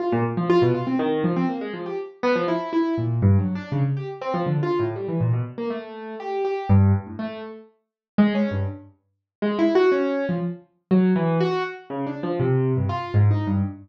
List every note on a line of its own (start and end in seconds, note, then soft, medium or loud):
0.00 0.11 F4 medium
0.12 0.24 A#2 loud
0.37 0.48 F3 medium
0.50 0.61 F4 loud
0.62 0.73 B2 loud
0.74 0.86 F4 medium
0.87 0.98 C4 medium
0.99 1.21 D#3 loud
1.24 1.35 F3 medium
1.36 1.48 C4 medium
1.49 1.60 A#3 medium
1.61 1.72 G#3 medium
1.74 1.85 F3 medium
1.86 1.97 G4 medium
2.23 2.34 B3 loud
2.36 2.47 F3 loud
2.48 2.70 E4 medium
2.73 2.95 E4 medium
2.98 3.20 A#2 medium
3.22 3.37 G2 loud
3.39 3.54 F#3 medium
3.55 3.70 D4 medium
3.72 3.83 C#3 medium
3.97 4.08 G4 medium
4.21 4.33 C4 medium
4.34 4.45 F3 medium
4.46 4.61 D3 medium
4.63 4.78 F4 medium
4.79 4.94 A2 medium
4.96 5.07 G3 medium
5.08 5.19 E3 medium
5.21 5.32 A#2 medium
5.33 5.44 B2 medium
5.58 5.69 A#3 medium
5.70 6.15 A3 medium
6.20 6.42 G4 medium
6.45 6.67 G4 medium
6.69 6.92 G2 loud
6.94 7.05 G2 medium
7.07 7.18 A2 soft
7.19 7.41 A3 medium
8.18 8.33 G#3 loud
8.35 8.50 C#4 medium
8.51 8.66 G2 medium
9.42 9.57 G#3 medium
9.59 9.74 E4 medium
9.75 9.90 F#4 loud
9.92 10.25 C#4 medium
10.29 10.40 F3 medium
10.91 11.13 F#3 medium
11.16 11.38 E3 loud
11.40 11.63 F#4 loud
11.90 12.05 C#3 medium
12.07 12.21 D4 medium
12.23 12.38 F3 medium
12.40 12.73 C3 medium
12.77 12.88 G2 medium
12.89 13.12 F4 medium
13.14 13.29 G#2 loud
13.31 13.45 D#4 medium
13.47 13.62 G2 medium